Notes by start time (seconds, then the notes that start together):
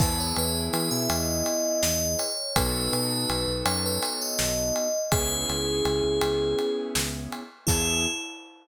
0.00 E2 B3 E4 G#4 B4, kick, crash
0.20 C#5
0.36 E2 B4, ride
0.73 E3 B4, ride
0.91 B2 E5
1.10 E2 D#5, ride
1.46 ride
1.83 E2 D#5, snare
2.19 C#5, ride
2.56 B1 B3 D#4 F#4 A4 B4, kick, ride
2.93 B2 B4, ride
3.29 B1, ride
3.48 B1
3.65 F#2 C#5, ride
3.86 B4
4.03 C#5, ride
4.21 D#5
4.39 B1, snare
4.76 ride
5.12 C#2 B3 C#4 E4 G#4, kick, ride
5.49 C#2, ride
5.85 C#2, ride
6.04 C#2
6.21 C#2, ride
6.59 ride
6.95 C#2, snare
7.32 ride
7.67 E2 B3 E4 G#4, kick, crash